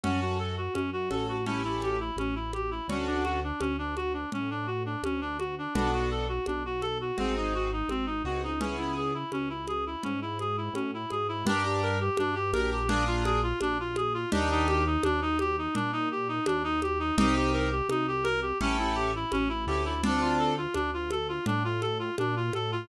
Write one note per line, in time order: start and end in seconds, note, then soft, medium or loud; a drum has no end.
0.04 0.69 F#2 medium
0.04 0.54 C#4 loud
0.04 0.20 C#4 medium
0.04 0.54 F#4 loud
0.04 0.54 A4 loud
0.04 low conga loud
0.21 0.38 F#4 medium
0.39 0.56 A4 medium
0.57 0.74 F#4 medium
0.74 1.10 F#2 medium
0.74 0.90 C#4 medium
0.74 high conga medium
0.93 1.09 F#4 medium
1.11 2.11 A1 medium
1.11 1.36 C#4 medium
1.11 1.36 F#4 medium
1.11 1.36 A4 loud
1.11 1.27 A4 medium
1.11 high conga medium
1.28 1.45 F#4 medium
1.46 1.62 C#4 medium
1.46 1.97 C#4 loud
1.46 1.97 E4 loud
1.46 1.97 G4 loud
1.46 1.97 A4 loud
1.46 low conga medium
1.64 1.81 E4 medium
1.82 1.99 G4 medium
1.82 high conga medium
2.00 2.17 E4 medium
2.16 2.81 A1 medium
2.16 2.35 C#4 medium
2.16 high conga medium
2.35 2.52 E4 medium
2.53 2.70 G4 medium
2.53 high conga medium
2.71 2.87 E4 medium
2.88 3.52 D2 medium
2.88 3.39 C#4 loud
2.88 3.07 C#4 medium
2.88 3.39 D4 loud
2.88 3.39 F#4 loud
2.88 3.39 A4 loud
2.88 low conga loud
3.07 3.23 D4 medium
3.24 3.40 F#4 medium
3.24 high conga medium
3.44 3.60 D4 medium
3.60 4.25 D2 medium
3.60 3.76 C#4 medium
3.60 high conga medium
3.78 3.95 D4 medium
3.96 4.13 F#4 medium
3.96 high conga medium
4.14 4.30 D4 medium
4.32 4.96 A2 medium
4.32 4.50 C#4 medium
4.32 low conga medium
4.50 4.67 D4 medium
4.67 4.83 F#4 medium
4.86 5.02 D4 medium
5.03 5.67 D2 medium
5.03 5.21 C#4 medium
5.03 high conga medium
5.21 5.38 D4 medium
5.39 5.55 F#4 medium
5.39 high conga medium
5.58 5.74 D4 medium
5.74 6.40 B1 medium
5.74 6.25 B3 loud
5.74 5.91 D4 medium
5.74 6.25 D4 loud
5.74 6.25 F#4 loud
5.74 6.25 A4 loud
5.74 low conga loud
5.93 6.10 F#4 medium
6.11 6.28 A4 medium
6.29 6.45 F#4 medium
6.46 7.12 B1 medium
6.46 6.63 D4 medium
6.46 high conga medium
6.65 6.82 F#4 medium
6.82 6.98 A4 medium
6.82 high conga medium
7.01 7.17 F#4 medium
7.18 7.83 G#1 medium
7.18 7.68 C4 loud
7.18 7.35 C4 medium
7.18 7.68 D#4 loud
7.18 7.68 F#4 loud
7.18 7.68 G#4 loud
7.18 low conga medium
7.37 7.53 D#4 medium
7.54 7.71 F#4 medium
7.72 7.89 D#4 medium
7.89 8.22 G#1 medium
7.89 8.06 C4 medium
7.89 high conga medium
8.06 8.22 D#4 medium
8.24 9.24 C#2 medium
8.24 8.50 C4 medium
8.24 8.50 D#4 medium
8.24 8.42 F#4 medium
8.24 8.50 F#4 medium
8.24 8.50 G#4 medium
8.43 8.60 D#4 medium
8.60 9.11 B3 loud
8.60 8.76 C#4 medium
8.60 9.11 C#4 loud
8.60 9.11 E4 loud
8.60 9.11 G#4 loud
8.60 low conga loud
8.78 8.94 E4 medium
8.97 9.14 G#4 medium
9.14 9.31 E4 medium
9.32 9.96 C#2 medium
9.32 9.49 C#4 medium
9.32 high conga medium
9.49 9.66 E4 medium
9.68 9.85 G#4 medium
9.68 high conga medium
9.86 10.03 E4 medium
10.03 10.69 G#2 medium
10.03 10.20 C#4 medium
10.03 low conga medium
10.22 10.38 E4 medium
10.39 10.56 G#4 medium
10.39 high conga medium
10.57 10.74 E4 medium
10.73 11.06 A2 medium
10.73 10.91 C#4 medium
10.73 high conga medium
10.94 11.10 E4 medium
11.10 11.43 G#2 medium
11.10 11.27 G#4 medium
11.10 high conga medium
11.28 11.45 E4 medium
11.45 12.10 G2 medium
11.45 11.96 D4 loud
11.45 11.64 D4 loud
11.45 11.96 G4 loud
11.45 11.96 A#4 loud
11.45 low conga loud
11.65 11.82 G4 medium
11.83 11.99 A#4 medium
12.00 12.17 G4 medium
12.17 12.53 G2 medium
12.17 12.35 D4 loud
12.17 high conga loud
12.35 12.51 G4 medium
12.53 13.53 A#1 medium
12.53 12.79 D4 loud
12.53 12.79 G4 loud
12.53 12.70 A#4 medium
12.53 12.79 A#4 loud
12.53 high conga loud
12.72 12.89 G4 medium
12.88 13.04 D4 loud
12.88 13.39 D4 loud
12.88 13.39 F4 loud
12.88 13.39 G#4 loud
12.88 13.39 A#4 loud
12.88 low conga loud
13.07 13.24 F4 medium
13.25 13.41 G#4 medium
13.25 high conga medium
13.43 13.59 F4 medium
13.61 14.25 A#1 medium
13.61 13.78 D4 loud
13.61 high conga loud
13.80 13.96 F4 medium
13.96 14.13 G#4 medium
13.96 high conga loud
14.14 14.30 F4 medium
14.32 14.97 D#2 medium
14.32 14.82 D4 loud
14.32 14.49 D4 medium
14.32 14.82 D#4 loud
14.32 14.82 G4 loud
14.32 14.82 A#4 loud
14.32 low conga loud
14.51 14.67 D#4 loud
14.68 14.84 G4 loud
14.68 high conga medium
14.86 15.03 D#4 medium
15.03 15.68 D#2 medium
15.03 15.20 D4 loud
15.03 high conga loud
15.22 15.38 D#4 medium
15.39 15.56 G4 loud
15.39 high conga medium
15.58 15.75 D#4 medium
15.75 16.40 A#2 medium
15.75 15.92 D4 loud
15.75 low conga loud
15.92 16.09 D#4 medium
16.11 16.28 G4 medium
16.28 16.45 D#4 medium
16.46 17.11 D#2 medium
16.46 16.63 D4 medium
16.46 high conga loud
16.64 16.80 D#4 loud
16.82 16.99 G4 medium
16.82 high conga medium
17.00 17.16 D#4 medium
17.18 17.82 C2 medium
17.18 17.68 C4 loud
17.18 17.68 D#4 loud
17.18 17.35 D#4 loud
17.18 17.68 G4 loud
17.18 17.68 A#4 loud
17.18 low conga loud
17.35 17.52 G4 medium
17.53 17.70 A#4 medium
17.71 17.88 G4 medium
17.89 18.53 C2 medium
17.89 18.06 D#4 medium
17.89 high conga loud
18.08 18.24 G4 medium
18.24 18.40 A#4 loud
18.24 high conga medium
18.42 18.58 G4 medium
18.61 19.25 A1 medium
18.61 19.11 C#4 loud
18.61 18.77 C#4 loud
18.61 19.11 E4 loud
18.61 19.11 G4 loud
18.61 19.11 A4 loud
18.61 low conga loud
18.79 18.96 E4 medium
18.95 19.12 G4 medium
19.16 19.32 E4 medium
19.32 19.66 A1 medium
19.32 19.49 C#4 loud
19.32 high conga loud
19.49 19.65 E4 medium
19.67 20.67 D2 medium
19.67 19.93 C#4 loud
19.67 19.93 E4 loud
19.67 19.84 G4 medium
19.67 19.93 G4 loud
19.67 19.93 A4 loud
19.85 20.01 E4 medium
20.03 20.53 C4 loud
20.03 20.53 D4 loud
20.03 20.21 D4 medium
20.03 20.53 F4 loud
20.03 20.53 A4 loud
20.03 low conga loud
20.21 20.38 F4 medium
20.39 20.55 A4 medium
20.57 20.74 F4 medium
20.74 21.39 D2 medium
20.74 20.91 D4 loud
20.74 high conga loud
20.94 21.10 F4 medium
21.11 21.28 A4 medium
21.11 high conga medium
21.29 21.45 F4 medium
21.46 22.10 A2 medium
21.46 21.63 D4 loud
21.46 low conga loud
21.64 21.81 F4 medium
21.81 21.98 A4 medium
21.81 high conga medium
21.99 22.16 F4 medium
22.18 22.50 A#2 medium
22.18 22.35 D4 medium
22.18 high conga loud
22.36 22.53 F4 medium
22.53 22.85 A2 medium
22.53 22.71 A4 loud
22.53 high conga medium
22.72 22.88 F4 loud